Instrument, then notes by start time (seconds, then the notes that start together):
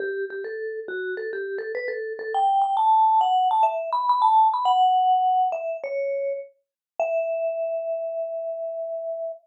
vibraphone
0.00 G4
0.30 G4
0.44 A4
0.88 F#4
1.17 A4
1.33 G4
1.58 A4
1.75 B4
1.88 A4
2.19 A4
2.34 G5
2.62 G5
2.77 A5
3.21 F#5
3.51 A5
3.63 E5
3.92 B5
4.09 B5
4.22 A5
4.54 B5
4.65 F#5
5.52 E5
5.84 C#5
7.00 E5